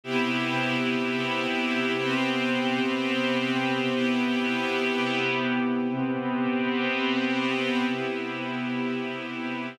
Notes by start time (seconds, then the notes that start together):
0.04 C3 B3 E4 G4
1.98 C3 B3 C4 G4
3.94 C3 B3 E4 G4
5.89 C3 B3 C4 G4
7.86 C3 B3 E4 G4